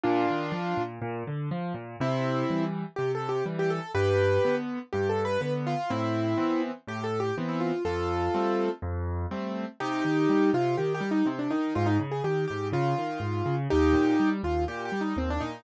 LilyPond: <<
  \new Staff \with { instrumentName = "Acoustic Grand Piano" } { \time 4/4 \key c \minor \tempo 4 = 123 <d' f'>2 r2 | \key c \major <c' e'>4. r8 \tuplet 3/2 { g'8 a'8 g'8 } r16 g'16 a'8 | <g' b'>4. r8 \tuplet 3/2 { g'8 a'8 b'8 } b'16 r16 f'8 | <c' e'>4. r8 \tuplet 3/2 { g'8 a'8 g'8 } r16 e'16 f'8 |
<f' a'>2 r2 | \key c \minor <ees' g'>4. f'8 \tuplet 3/2 { g'8 g'8 ees'8 } c'16 d'16 ees'8 | f'16 ees'16 r16 aes'16 g'8 g'8 f'2 | <ees' g'>4. f'8 \tuplet 3/2 { g'8 g'8 ees'8 } c'16 d'16 ees'8 | }
  \new Staff \with { instrumentName = "Acoustic Grand Piano" } { \time 4/4 \key c \minor bes,8 ees8 f8 bes,8 bes,8 d8 f8 bes,8 | \key c \major c4 <e g>4 c4 <e g>4 | g,4 <d b>4 g,4 <d b>4 | a,4 <e b c'>4 a,4 <e b c'>4 |
f,4 <g a c'>4 f,4 <g a c'>4 | \key c \minor c8 ees8 g8 c8 ees8 g8 c8 ees8 | aes,8 des8 ees8 aes,8 des8 ees8 aes,8 des8 | ees,8 bes,8 g8 ees,8 bes,8 g8 ees,8 bes,8 | }
>>